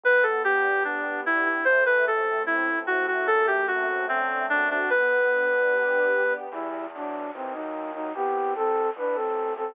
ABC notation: X:1
M:2/4
L:1/16
Q:1/4=74
K:G
V:1 name="Clarinet"
B A G2 D2 E E | c B A2 E2 F F | A G F2 C2 D D | B8 |
[K:Em] z8 | z8 |]
V:2 name="Flute"
z8 | z8 | z8 | z8 |
[K:Em] [G,E]2 [F,D]2 [E,C] [F,^D]2 [F,D] | [B,G]2 [CA]2 [DB] [CA]2 [CA] |]
V:3 name="String Ensemble 1"
B,2 D2 G2 B,2 | A,2 C2 E2 A,2 | A,2 C2 D2 F2 | B,2 D2 G2 B,2 |
[K:Em] z8 | z8 |]
V:4 name="Acoustic Grand Piano" clef=bass
G,,,8 | A,,,8 | F,,8 | G,,,8 |
[K:Em] E,,4 ^D,,4 | C,,4 A,,,4 |]